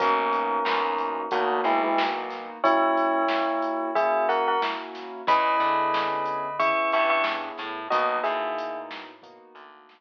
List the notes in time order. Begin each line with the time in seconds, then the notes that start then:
0.00 B1 A#3 B3 C#4 D#4 F#4 A#4, kick, closed hi-hat
0.33 closed hi-hat
0.65 E2 A#3 B3 D#4 F#4, snare
0.98 closed hi-hat
1.31 D2 A#3 B3 D#4 F#4, kick, closed hi-hat
1.64 B1 G#3 E4, closed hi-hat
1.84 G#3 E4
1.98 A#3 B3 D#4 F#4, snare
2.30 snare, closed hi-hat
2.64 A#3 C#4 E4 F#4 C#5, kick, closed hi-hat
2.97 closed hi-hat
3.28 A#3 C#4 E4 F#4, snare
3.62 closed hi-hat
3.95 A#3 C#4 E4 F#4 G#4 E5, kick, closed hi-hat
4.29 A#4 F#5, closed hi-hat
4.48 A#4 F#5
4.62 A#3 C#4 E4 F#4, snare
4.95 snare, closed hi-hat
5.27 E2 B3 C#4 E4 G#4 D#5 B5, kick, closed hi-hat
5.60 D3, closed hi-hat
5.94 snare
6.25 closed hi-hat
6.59 B3 C#4 E4 G#4 E5 C#6, kick, closed hi-hat
6.92 G2 E5 C#6, closed hi-hat
7.10 E5 C#6
7.24 snare
7.58 A2, snare, closed hi-hat
7.90 B1 A#3 B3 D#4 F#4 D#5, kick, closed hi-hat
8.23 A2 G#4 E5, closed hi-hat
8.58 closed hi-hat
8.91 snare
9.22 A#3 B3 D#4 F#4, kick, closed hi-hat
9.55 D2, closed hi-hat
9.89 snare